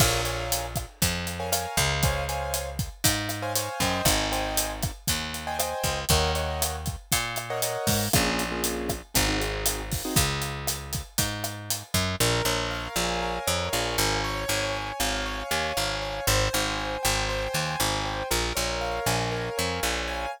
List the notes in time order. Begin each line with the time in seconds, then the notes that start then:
0.00 A#1 A#4 C#5 F5 G#5, kick, cross-stick, crash
0.25 A#4 C#5 F5 G#5, closed hi-hat
0.52 closed hi-hat
0.76 kick, cross-stick, closed hi-hat
1.02 F2, kick, closed hi-hat
1.27 closed hi-hat
1.40 A#4 C#5 F5 G#5
1.52 A#4 C#5 F5 G#5, cross-stick, closed hi-hat
1.77 C#2, kick, closed hi-hat
2.03 C5 C#5 F5 G#5, kick, closed hi-hat
2.29 C5 C#5 F5 G#5, closed hi-hat
2.54 cross-stick, closed hi-hat
2.79 kick, closed hi-hat
3.04 G#2, kick, closed hi-hat
3.29 cross-stick, closed hi-hat
3.42 C5 C#5 F5 G#5
3.56 C5 C#5 F5 G#5, closed hi-hat
3.80 F#2 C5 D#5 G5 G#5, kick, closed hi-hat
4.05 G#1, kick, cross-stick, closed hi-hat
4.32 C5 D#5 G5 G#5, closed hi-hat
4.57 closed hi-hat
4.83 kick, cross-stick, closed hi-hat
5.08 D#2, kick, closed hi-hat
5.34 closed hi-hat
5.47 C5 D#5 G5 G#5
5.59 C5 D#5 G5 G#5, cross-stick, closed hi-hat
5.83 C#2, kick, closed hi-hat
6.09 D#2 A#4 C#5 D#5 F#5, kick, closed hi-hat
6.35 A#4 C#5 D#5 F#5, closed hi-hat
6.62 cross-stick, closed hi-hat
6.86 kick, closed hi-hat
7.12 A#2, kick, closed hi-hat
7.36 cross-stick, closed hi-hat
7.50 A#4 C#5 D#5 F#5
7.62 A#4 C#5 D#5 F#5, closed hi-hat
7.87 G#2, kick, open hi-hat
8.13 A#1 A#3 C#4 F4 G#4, kick, cross-stick, closed hi-hat
8.39 closed hi-hat
8.51 A#3 C#4 F4 G#4
8.64 closed hi-hat
8.89 kick, cross-stick, closed hi-hat
9.14 G#1 C4 D#4 F#4 G#4, kick, closed hi-hat
9.28 C4 D#4 F#4 G#4
9.40 C4 D#4 F#4 G#4, closed hi-hat
9.66 cross-stick, closed hi-hat
9.92 kick, open hi-hat
10.05 C4 D#4 F#4 G#4
10.16 C#2, kick, closed hi-hat
10.42 closed hi-hat
10.67 cross-stick, closed hi-hat
10.93 kick, closed hi-hat
11.18 G#2, kick, closed hi-hat
11.44 cross-stick, closed hi-hat
11.70 closed hi-hat
11.94 F#2, kick, closed hi-hat
12.20 A#1 A#4
12.45 A#1 C#5
12.71 F5
12.96 A#1 G#5
13.22 A#4
13.47 F2 C#5
13.72 A#1 F5
13.98 G#1 G#5
14.24 C#5
14.48 G#1 G#5
14.75 C#5
15.00 G#1 F5
15.26 C#5
15.51 D#2 G#5
15.77 G#1 F5
16.02 C#5
16.27 G#1 C5
16.53 G#1 G#5
16.78 C5
17.03 G#1 G5
17.29 C5
17.53 D#2 G#5
17.80 G#1 G5
18.05 C5
18.31 A#1 A#4
18.55 A#1 C#5
18.81 F5
19.06 A#1 G#5
19.32 A#4
19.58 F2 C#5
19.83 A#1 F5
20.08 G#5